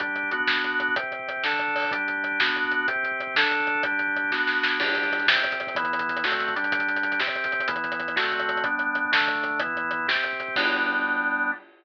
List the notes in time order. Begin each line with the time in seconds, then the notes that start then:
0.00 G3 D4 G4, kick, closed hi-hat
0.08 kick
0.16 kick, closed hi-hat
0.23 kick
0.31 B3 D4 F#4, kick, closed hi-hat
0.40 kick
0.47 kick, snare
0.56 kick
0.64 kick, closed hi-hat
0.72 kick
0.80 kick, closed hi-hat
0.88 kick
0.96 C3 C4 G4, kick, closed hi-hat
1.04 kick
1.12 kick, closed hi-hat
1.19 kick
1.28 kick, closed hi-hat
1.37 kick
1.44 D3 D4 A4, kick, snare
1.53 kick
1.59 kick, closed hi-hat
1.68 kick
1.75 kick, open hi-hat
1.84 kick
1.91 G3 D4 G4, kick, closed hi-hat
1.99 kick
2.08 kick, closed hi-hat
2.17 kick
2.24 kick, closed hi-hat
2.32 kick
2.40 B3 D4 F#4, kick, snare
2.48 kick
2.56 kick, closed hi-hat
2.64 kick
2.71 kick, closed hi-hat
2.81 kick
2.88 C3 C4 G4, kick, closed hi-hat
2.96 kick
3.03 kick, closed hi-hat
3.12 kick
3.20 kick, closed hi-hat
3.27 kick
3.35 D3 D4 A4, kick, snare
3.43 kick
3.51 kick, closed hi-hat
3.60 kick
3.67 kick, closed hi-hat
3.75 kick
3.83 G3 D4 G4, kick, closed hi-hat
3.92 kick
3.99 kick, closed hi-hat
4.08 kick
4.16 kick, closed hi-hat
4.24 kick
4.31 B3 D4 F#4, kick, snare
4.47 snare
4.63 snare
4.80 G3 D4 G4, kick, crash
4.87 kick, closed hi-hat
4.95 kick, closed hi-hat
5.03 kick, closed hi-hat
5.12 kick, closed hi-hat
5.19 kick, closed hi-hat
5.27 C3 C4 G4, kick, snare
5.35 kick, closed hi-hat
5.44 kick, closed hi-hat
5.52 kick, closed hi-hat
5.60 kick, closed hi-hat
5.67 kick, closed hi-hat
5.75 E3 B3 E4, kick, closed hi-hat
5.84 kick, closed hi-hat
5.92 kick, closed hi-hat
5.99 kick, closed hi-hat
6.09 kick, closed hi-hat
6.16 kick, closed hi-hat
6.24 D3 A3 C4 F#4, kick, snare
6.32 kick, closed hi-hat
6.39 kick, closed hi-hat
6.48 kick, closed hi-hat
6.55 G3 D4 G4, kick, closed hi-hat
6.63 kick, closed hi-hat
6.72 kick, closed hi-hat
6.79 kick, closed hi-hat
6.88 kick, closed hi-hat
6.96 kick, closed hi-hat
7.03 kick, closed hi-hat
7.12 kick, closed hi-hat
7.20 C3 C4 G4, kick, snare
7.27 kick, closed hi-hat
7.35 kick, closed hi-hat
7.44 kick, closed hi-hat
7.52 kick, closed hi-hat
7.60 kick, closed hi-hat
7.68 E3 B3 E4, kick, closed hi-hat
7.76 kick, closed hi-hat
7.84 kick, closed hi-hat
7.92 kick, closed hi-hat
8.00 kick, closed hi-hat
8.08 kick, closed hi-hat
8.16 D3 A3 C4 F#4, kick, snare
8.23 kick, closed hi-hat
8.32 kick, closed hi-hat
8.39 kick, closed hi-hat
8.49 kick, closed hi-hat
8.56 kick, closed hi-hat
8.64 G3 B3 D4, kick, closed hi-hat
8.72 kick
8.79 kick, closed hi-hat
8.87 kick
8.95 kick, closed hi-hat
9.05 kick
9.12 D3 A3 D4, kick, snare
9.21 kick
9.28 kick, closed hi-hat
9.35 kick
9.44 kick, closed hi-hat
9.51 kick
9.60 E3 B3 E4, kick, closed hi-hat
9.67 kick
9.75 kick, closed hi-hat
9.84 kick
9.91 kick, closed hi-hat
9.99 kick
10.07 C3 C4 G4, kick, snare
10.16 kick
10.24 kick, closed hi-hat
10.33 kick
10.40 kick, closed hi-hat
10.48 kick
10.56 G3 B3 D4, kick, crash